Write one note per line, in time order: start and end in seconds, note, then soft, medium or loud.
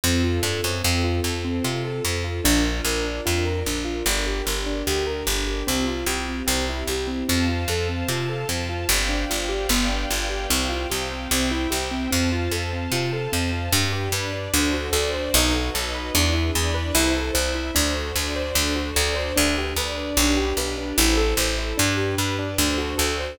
0.04 0.40 F2 loud
0.04 0.83 C4 medium
0.04 0.22 C4 medium
0.04 0.83 F4 medium
0.04 0.83 A4 medium
0.24 0.42 F4 medium
0.43 0.61 G2 medium
0.43 0.61 A4 medium
0.64 0.82 F#2 medium
0.64 0.83 C4 medium
0.84 1.21 F2 loud
0.84 1.02 C4 medium
0.84 2.43 C4 medium
0.84 2.43 F4 medium
0.84 2.43 A4 medium
1.04 1.22 F4 medium
1.24 1.60 F2 medium
1.24 1.43 A4 medium
1.45 1.63 C4 medium
1.64 2.01 C3 medium
1.64 1.83 F4 medium
1.85 2.03 A4 medium
2.04 2.41 F2 medium
2.04 2.22 C4 medium
2.24 2.42 F4 medium
2.44 2.81 A#1 loud
2.44 2.63 D4 medium
2.44 4.04 D4 medium
2.44 4.04 F4 medium
2.44 4.04 A#4 medium
2.65 2.83 F4 medium
2.85 3.21 A#1 medium
2.85 3.04 A#4 medium
3.04 3.22 D4 medium
3.26 3.63 F2 medium
3.26 3.44 F4 medium
3.45 3.64 A#4 medium
3.66 4.03 A#1 medium
3.66 3.85 D4 medium
3.85 4.03 F4 medium
4.06 4.42 G1 loud
4.06 5.66 D4 medium
4.06 4.25 D4 medium
4.06 5.66 G4 medium
4.06 5.66 A#4 medium
4.27 4.45 G4 medium
4.46 4.83 G1 medium
4.46 4.64 A#4 medium
4.66 4.85 D4 medium
4.87 5.23 D2 medium
4.87 5.05 G4 medium
5.07 5.25 A#4 medium
5.27 5.63 G1 medium
5.27 5.46 D4 medium
5.47 5.65 G4 medium
5.67 6.04 C2 medium
5.67 5.85 C4 medium
5.67 6.47 C4 medium
5.67 6.47 F4 medium
5.67 6.47 G4 medium
5.87 6.05 F4 medium
6.06 6.43 C2 medium
6.06 6.25 G4 medium
6.29 6.46 C4 medium
6.47 6.84 C2 loud
6.47 6.65 C4 medium
6.47 7.28 C4 medium
6.47 7.28 E4 medium
6.47 7.28 G4 medium
6.69 6.87 E4 medium
6.88 7.24 C2 medium
6.88 7.07 G4 medium
7.07 7.26 C4 medium
7.28 7.65 F2 loud
7.28 7.47 C4 medium
7.28 8.88 C5 medium
7.28 8.88 F5 medium
7.28 8.88 A5 medium
7.49 7.67 F4 medium
7.68 8.04 F2 medium
7.68 7.88 A4 medium
7.89 8.07 C4 medium
8.08 8.45 C3 medium
8.08 8.27 F4 medium
8.29 8.48 A4 medium
8.49 8.85 F2 medium
8.49 8.67 C4 medium
8.69 8.87 F4 medium
8.89 9.25 G1 loud
8.89 9.08 C4 medium
8.89 9.70 C5 medium
8.89 9.69 D5 medium
8.89 9.69 F5 medium
8.89 9.69 G5 medium
9.09 9.27 D4 medium
9.30 9.67 G1 medium
9.30 9.48 F4 medium
9.49 9.67 G4 medium
9.69 10.06 G1 loud
9.69 9.88 B3 medium
9.69 10.50 B4 medium
9.69 10.50 D5 medium
9.69 10.50 F5 medium
9.69 10.50 G5 medium
9.89 10.07 D4 medium
10.10 10.47 G1 medium
10.10 10.28 F4 medium
10.30 10.48 G4 medium
10.50 10.87 C2 loud
10.50 10.68 C4 medium
10.50 11.30 C5 medium
10.50 11.30 F5 medium
10.50 11.30 G5 medium
10.69 10.87 F4 medium
10.90 11.28 C2 medium
10.90 11.08 G4 medium
11.11 11.29 C4 medium
11.31 11.67 C2 loud
11.31 11.49 C4 medium
11.31 12.11 C5 medium
11.31 12.11 E5 medium
11.31 12.11 G5 medium
11.51 11.69 E4 medium
11.70 12.08 C2 medium
11.70 11.89 G4 medium
11.91 12.09 C4 medium
12.11 12.49 F2 loud
12.11 12.29 C4 medium
12.11 13.71 C5 medium
12.11 13.71 F5 medium
12.11 13.71 A5 medium
12.32 12.51 F4 medium
12.52 12.88 F2 medium
12.52 12.70 A4 medium
12.73 12.91 C4 medium
12.92 13.28 C3 medium
12.92 13.11 F4 medium
13.13 13.31 A4 medium
13.32 13.69 F2 medium
13.32 13.51 C4 medium
13.52 13.70 F4 medium
13.72 14.09 G2 loud
13.72 13.90 D4 medium
13.72 14.13 D4 medium
13.72 14.13 G4 medium
13.72 14.13 B4 medium
13.93 14.11 G4 medium
14.12 14.48 G2 medium
14.12 14.52 D4 medium
14.12 14.53 B4 medium
14.12 14.31 B4 medium
14.12 14.53 D5 medium
14.33 14.51 D4 medium
14.53 14.90 D2 loud
14.53 14.93 D4 medium
14.53 14.72 D4 medium
14.53 14.93 F#4 medium
14.53 14.93 A4 medium
14.53 14.93 C5 medium
14.74 14.92 F#4 medium
14.93 15.29 D2 loud
14.93 15.33 D4 medium
14.93 15.33 F#4 medium
14.93 15.11 A4 medium
14.93 15.33 C5 medium
14.93 15.33 D5 medium
15.14 15.32 C5 medium
15.34 15.70 B1 loud
15.34 15.73 D#4 medium
15.34 15.53 D#4 medium
15.34 15.73 F#4 medium
15.34 15.73 A4 medium
15.34 15.73 B4 medium
15.55 15.73 F#4 medium
15.74 16.11 B1 medium
15.74 16.14 D#4 medium
15.74 16.14 F#4 medium
15.74 15.92 A4 medium
15.74 16.14 B4 medium
15.74 16.14 D#5 medium
15.95 16.13 B4 medium
16.14 16.51 E2 loud
16.14 16.54 D4 medium
16.14 16.33 D4 medium
16.14 16.54 E4 medium
16.14 16.54 G#4 medium
16.14 16.54 B4 medium
16.33 16.52 E4 medium
16.54 16.92 E2 medium
16.54 16.94 D4 medium
16.54 16.94 E4 medium
16.54 16.74 G#4 medium
16.54 16.94 B4 medium
16.54 16.94 D5 medium
16.74 16.93 B4 medium
16.95 17.31 C2 loud
16.95 17.35 E4 medium
16.95 17.13 E4 loud
16.95 17.35 A4 medium
16.95 17.35 C5 medium
17.15 17.33 A4 medium
17.34 17.71 C2 loud
17.34 17.75 E4 medium
17.34 17.52 C5 medium
17.34 17.75 C5 medium
17.34 17.75 E5 medium
17.55 17.73 E4 medium
17.75 18.12 D2 loud
17.75 17.93 D4 medium
17.75 18.15 D4 medium
17.75 18.15 F#4 medium
17.75 18.15 A4 medium
17.75 18.15 C5 medium
17.96 18.14 F#4 medium
18.16 18.52 D2 loud
18.16 18.55 D4 medium
18.16 18.55 F#4 medium
18.16 18.34 A4 medium
18.16 18.55 C5 medium
18.16 18.56 D5 medium
18.36 18.54 C5 medium
18.55 18.92 D2 loud
18.55 18.73 D4 loud
18.55 18.95 D4 medium
18.55 18.95 F#4 medium
18.55 18.95 A4 medium
18.55 18.95 C5 medium
18.76 18.94 F#4 medium
18.96 19.33 D2 loud
18.96 19.36 D4 medium
18.96 19.36 F#4 medium
18.96 19.14 A4 medium
18.96 19.36 C5 medium
18.96 19.36 D5 medium
19.16 19.34 C5 medium
19.36 19.74 D2 loud
19.36 19.54 D4 medium
19.36 19.76 D4 medium
19.36 19.76 G4 medium
19.36 19.76 B4 medium
19.58 19.76 G4 medium
19.76 20.13 D2 medium
19.76 20.17 D4 medium
19.76 20.17 B4 medium
19.76 19.96 B4 medium
19.76 20.17 D5 medium
19.97 20.16 D4 medium
20.17 20.53 B1 loud
20.17 20.97 D4 medium
20.17 20.35 D4 medium
20.17 20.97 G4 medium
20.17 20.97 B4 medium
20.37 20.55 G4 medium
20.57 20.93 B1 medium
20.57 20.76 B4 medium
20.78 20.96 D4 medium
20.98 21.34 A1 loud
20.98 21.77 E4 medium
20.98 21.16 E4 medium
20.98 21.77 A4 medium
20.98 21.77 C5 medium
21.17 21.35 A4 medium
21.37 21.73 A1 loud
21.37 21.56 C5 medium
21.58 21.76 E4 medium
21.78 22.15 G2 loud
21.78 21.96 D4 medium
21.78 22.58 D4 medium
21.78 22.58 G4 medium
21.78 22.58 B4 medium
21.97 22.16 G4 medium
22.18 22.55 G2 medium
22.18 22.36 B4 medium
22.39 22.57 D4 medium
22.58 22.95 D2 loud
22.58 22.77 D4 medium
22.58 23.38 D4 medium
22.58 23.38 F#4 medium
22.58 23.38 A4 medium
22.58 23.38 C5 medium
22.78 22.96 F#4 medium
22.98 23.35 D2 loud
22.98 23.16 A4 medium
23.20 23.38 C5 medium